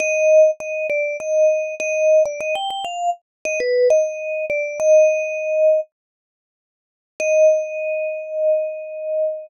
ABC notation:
X:1
M:4/4
L:1/16
Q:1/4=100
K:Eb
V:1 name="Vibraphone"
e4 e2 d2 e4 e3 d | e g g f2 z2 e _c2 e4 d2 | e8 z8 | e16 |]